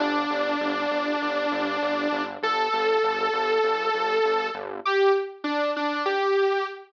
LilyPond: <<
  \new Staff \with { instrumentName = "Lead 2 (sawtooth)" } { \time 4/4 \key g \major \tempo 4 = 99 d'1 | a'1 | g'8 r8 d'8 d'8 g'4 r4 | }
  \new Staff \with { instrumentName = "Synth Bass 1" } { \clef bass \time 4/4 \key g \major g,,8 g,,8 g,,8 g,,8 g,,8 g,,8 g,,8 g,,8 | g,,8 g,,8 g,,8 g,,8 g,,8 g,,8 g,,8 g,,8 | r1 | }
>>